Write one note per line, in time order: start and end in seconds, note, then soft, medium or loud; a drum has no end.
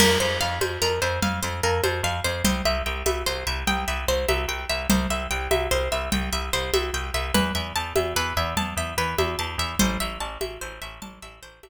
0.00 0.17 F2 loud
0.00 0.18 A#4 loud
0.00 crash loud
0.00 low conga loud
0.20 0.38 F2 loud
0.20 0.39 C5 medium
0.41 0.59 F2 medium
0.41 0.59 F5 loud
0.61 0.78 F2 medium
0.61 0.80 C5 medium
0.61 high conga loud
0.82 1.00 F2 medium
0.82 1.00 A#4 loud
1.02 1.19 F2 loud
1.02 1.20 C5 medium
1.22 1.40 F2 loud
1.22 1.41 F5 medium
1.22 low conga loud
1.43 1.61 F2 loud
1.43 1.61 C5 medium
1.63 1.81 F2 loud
1.63 1.82 A#4 medium
1.84 2.01 F2 loud
1.84 2.02 C5 medium
1.84 high conga loud
2.03 2.20 F2 loud
2.03 2.22 F5 loud
2.24 2.42 F2 loud
2.24 2.43 C5 loud
2.44 2.62 C2 loud
2.44 2.63 C5 loud
2.44 low conga loud
2.65 2.82 C2 loud
2.65 2.84 E5 loud
2.86 3.03 C2 loud
2.86 3.04 G5 medium
3.06 3.23 C2 medium
3.06 3.24 E5 loud
3.06 high conga loud
3.26 3.44 C2 medium
3.26 3.45 C5 loud
3.47 3.64 C2 loud
3.47 3.65 E5 medium
3.67 3.85 C2 loud
3.67 3.86 G5 loud
3.67 low conga medium
3.88 4.05 C2 loud
3.88 4.06 E5 medium
4.08 4.25 C2 loud
4.08 4.27 C5 loud
4.28 4.46 C2 loud
4.28 4.47 E5 loud
4.28 high conga medium
4.48 4.65 C2 medium
4.48 4.67 G5 medium
4.69 4.87 C2 medium
4.69 4.88 E5 medium
4.90 5.07 C2 loud
4.90 5.08 C5 loud
4.90 low conga loud
5.10 5.27 C2 medium
5.10 5.29 E5 medium
5.31 5.48 C2 loud
5.31 5.49 G5 medium
5.51 5.68 C2 loud
5.51 5.69 E5 loud
5.51 high conga loud
5.71 5.89 C2 loud
5.71 5.90 C5 loud
5.92 6.09 C2 loud
5.92 6.10 E5 medium
6.12 6.30 C2 loud
6.12 6.30 G5 loud
6.12 low conga loud
6.33 6.50 C2 medium
6.33 6.51 E5 medium
6.53 6.71 C2 medium
6.53 6.72 C5 loud
6.74 6.91 C2 medium
6.74 6.92 E5 medium
6.74 high conga loud
6.93 7.11 C2 medium
6.93 7.12 G5 medium
7.14 7.31 C2 loud
7.14 7.33 E5 medium
7.34 7.52 E2 loud
7.34 7.53 B4 loud
7.34 low conga loud
7.55 7.73 E2 loud
7.55 7.73 E5 medium
7.76 7.93 E2 loud
7.76 7.94 A5 loud
7.96 8.14 E2 loud
7.96 8.14 E5 medium
7.96 high conga loud
8.16 8.33 E2 loud
8.16 8.35 B4 loud
8.37 8.54 E2 loud
8.37 8.55 E5 medium
8.57 8.74 E2 loud
8.57 8.75 A5 loud
8.57 low conga medium
8.77 8.94 E2 medium
8.77 8.96 E5 medium
8.98 9.15 E2 loud
8.98 9.16 B4 loud
9.18 9.36 E2 loud
9.18 9.37 E5 medium
9.18 high conga loud
9.39 9.56 E2 loud
9.39 9.57 A5 medium
9.58 9.75 E2 loud
9.58 9.78 E5 medium
9.79 9.98 A1 loud
9.79 9.98 C5 loud
9.79 low conga loud
10.00 10.18 A1 medium
10.00 10.19 E5 loud
10.20 10.38 A1 loud
10.20 10.39 A5 medium
10.41 10.58 A1 medium
10.41 10.59 E5 medium
10.41 high conga loud
10.61 10.79 A1 medium
10.61 10.80 C5 medium
10.82 10.99 A1 loud
10.82 11.00 E5 medium
11.02 11.19 A1 medium
11.02 11.20 A5 medium
11.02 low conga loud
11.22 11.40 A1 loud
11.22 11.41 E5 medium
11.43 11.60 A1 medium
11.43 11.61 C5 loud
11.63 11.69 A1 loud
11.63 11.69 E5 medium
11.63 high conga loud